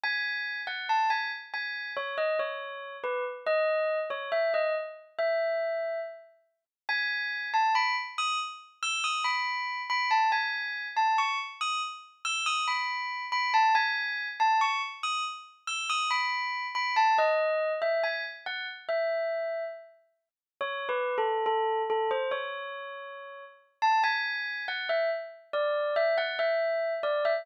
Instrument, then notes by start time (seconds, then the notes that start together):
tubular bells
0.04 G#5
0.67 F#5
0.89 A5
1.10 G#5
1.54 G#5
1.97 C#5
2.18 D#5
2.39 C#5
3.04 B4
3.46 D#5
4.10 C#5
4.32 E5
4.54 D#5
5.19 E5
6.89 G#5
7.54 A5
7.75 B5
8.18 D#6
8.83 E6
9.04 D#6
9.24 B5
9.90 B5
10.11 A5
10.32 G#5
10.97 A5
11.18 C#6
11.61 D#6
12.25 E6
12.46 D#6
12.68 B5
13.32 B5
13.54 A5
13.75 G#5
14.40 A5
14.61 C#6
15.03 D#6
15.68 E6
15.90 D#6
16.11 B5
16.75 B5
16.96 A5
17.18 D#5
17.82 E5
18.04 G#5
18.46 F#5
18.89 E5
20.61 C#5
20.89 B4
21.18 A4
21.46 A4
21.90 A4
22.11 C5
22.31 C#5
23.82 A5
24.04 G#5
24.68 F#5
24.89 E5
25.53 D5
25.96 E5
26.18 F#5
26.39 E5
27.03 D5
27.25 E5